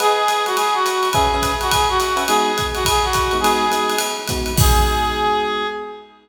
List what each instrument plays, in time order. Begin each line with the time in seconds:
0.00 electric piano 1 G#4 B4 D#5 F#5, clarinet G#4, ride
0.28 hi-hat pedal, ride
0.46 clarinet F#4, ride
0.57 clarinet G#4, ride
0.74 clarinet F#4
0.86 hi-hat pedal, ride
1.03 ride
1.13 electric piano 1 C#4 B4 E5 G#5, clarinet G#4, kick, ride
1.34 electric piano 1 C#4 B4 E5 G#5
1.42 kick, hi-hat pedal, ride
1.61 clarinet F#4, ride
1.71 clarinet G#4, kick, ride
1.89 clarinet F#4
2.00 hi-hat pedal, ride
2.16 electric piano 1 C#4 B4 E5 G#5, ride
2.27 electric piano 1 G#3 B3 D#4 F#4, clarinet G#4, ride
2.58 kick, hi-hat pedal, ride
2.75 clarinet F#4, ride
2.85 clarinet G#4, kick, ride
3.04 clarinet F#4
3.13 kick, hi-hat pedal, ride
3.31 electric piano 1 G#3 B3 D#4 F#4, ride
3.40 electric piano 1 G#3 B3 D#4 F#4, clarinet G#4
3.44 ride
3.71 electric piano 1 G#3 B3 D#4 F#4, hi-hat pedal, ride
3.89 ride
3.98 ride
4.27 electric piano 1 G#3 B3 D#4 F#4, kick, hi-hat pedal, ride
4.46 ride
4.56 electric piano 1 G#3 B3 D#4 F#4, clarinet G#4, kick, crash